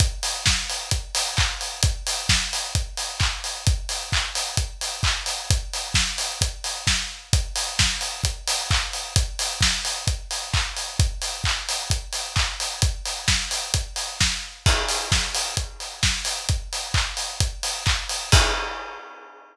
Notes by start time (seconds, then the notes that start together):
0.00 kick, closed hi-hat
0.23 open hi-hat
0.46 kick, snare
0.70 open hi-hat
0.91 kick, closed hi-hat
1.15 open hi-hat
1.37 kick, clap
1.61 open hi-hat
1.83 kick, closed hi-hat
2.07 open hi-hat
2.29 kick, snare
2.53 open hi-hat
2.75 kick, closed hi-hat
2.97 open hi-hat
3.20 kick, clap
3.44 open hi-hat
3.67 kick, closed hi-hat
3.89 open hi-hat
4.12 kick, clap
4.35 open hi-hat
4.57 kick, closed hi-hat
4.81 open hi-hat
5.03 kick, clap
5.26 open hi-hat
5.50 kick, closed hi-hat
5.73 open hi-hat
5.94 kick, snare
6.18 open hi-hat
6.41 kick, closed hi-hat
6.64 open hi-hat
6.87 kick, snare
7.33 kick, closed hi-hat
7.56 open hi-hat
7.79 kick, snare
8.01 open hi-hat
8.24 kick, closed hi-hat
8.48 open hi-hat
8.71 kick, clap
8.93 open hi-hat
9.16 kick, closed hi-hat
9.39 open hi-hat
9.61 kick, snare
9.85 open hi-hat
10.07 kick, closed hi-hat
10.31 open hi-hat
10.54 kick, clap
10.77 open hi-hat
10.99 kick, closed hi-hat
11.22 open hi-hat
11.44 kick, clap
11.69 open hi-hat
11.90 kick, closed hi-hat
12.13 open hi-hat
12.36 kick, clap
12.60 open hi-hat
12.82 kick, closed hi-hat
13.05 open hi-hat
13.28 kick, snare
13.51 open hi-hat
13.74 kick, closed hi-hat
13.96 open hi-hat
14.20 kick, snare
14.66 kick, crash
14.89 open hi-hat
15.12 kick, snare
15.35 open hi-hat
15.57 kick, closed hi-hat
15.80 open hi-hat
16.03 kick, snare
16.25 open hi-hat
16.49 kick, closed hi-hat
16.73 open hi-hat
16.94 kick, clap
17.17 open hi-hat
17.40 kick, closed hi-hat
17.63 open hi-hat
17.86 kick, clap
18.09 open hi-hat
18.32 kick, crash